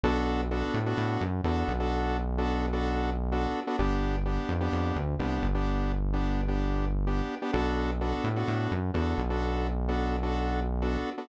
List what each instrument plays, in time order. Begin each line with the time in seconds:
0.04 synth bass 1 B1, lead 2 (sawtooth) B3 D4 F#4 A4
0.51 lead 2 (sawtooth) B3 D4 F#4 A4
0.74 synth bass 1 A2
0.86 lead 2 (sawtooth) B3 D4 F#4 A4
0.97 synth bass 1 A2
1.21 synth bass 1 F#2
1.44 synth bass 1 E2, lead 2 (sawtooth) B3 D4 F#4 A4
1.68 synth bass 1 B1
1.80 lead 2 (sawtooth) B3 D4 F#4 A4
2.38 lead 2 (sawtooth) B3 D4 F#4 A4
2.73 lead 2 (sawtooth) B3 D4 F#4 A4
3.32 lead 2 (sawtooth) B3 D4 F#4 A4
3.67 lead 2 (sawtooth) B3 D4 F#4 A4
3.79 synth bass 1 G1, lead 2 (sawtooth) B3 D4 G4
4.25 lead 2 (sawtooth) B3 D4 G4
4.49 synth bass 1 F2
4.61 lead 2 (sawtooth) B3 D4 G4
4.72 synth bass 1 F2
4.96 synth bass 1 D2
5.19 synth bass 1 C2, lead 2 (sawtooth) B3 D4 G4
5.42 synth bass 1 G1
5.54 lead 2 (sawtooth) B3 D4 G4
6.13 lead 2 (sawtooth) B3 D4 G4
6.48 lead 2 (sawtooth) B3 D4 G4
7.07 lead 2 (sawtooth) B3 D4 G4
7.42 lead 2 (sawtooth) B3 D4 G4
7.53 synth bass 1 B1, lead 2 (sawtooth) B3 D4 F#4 A4
8.01 lead 2 (sawtooth) B3 D4 F#4 A4
8.24 synth bass 1 A2
8.36 lead 2 (sawtooth) B3 D4 F#4 A4
8.48 synth bass 1 A2
8.71 synth bass 1 F#2
8.94 synth bass 1 E2, lead 2 (sawtooth) B3 D4 F#4 A4
9.18 synth bass 1 B1
9.30 lead 2 (sawtooth) B3 D4 F#4 A4
9.88 lead 2 (sawtooth) B3 D4 F#4 A4
10.23 lead 2 (sawtooth) B3 D4 F#4 A4
10.82 lead 2 (sawtooth) B3 D4 F#4 A4
11.18 lead 2 (sawtooth) B3 D4 F#4 A4